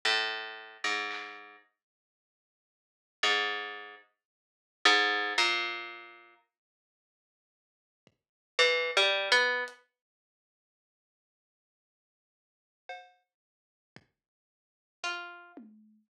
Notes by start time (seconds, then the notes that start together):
0.05 A2
0.84 G#2
1.11 clap
3.23 G#2
4.85 G#2
5.38 A#2, kick
8.07 kick
8.59 E3
8.97 G3
9.32 B3
9.68 closed hi-hat
12.89 cowbell
13.96 kick
15.04 F4, kick
15.57 high tom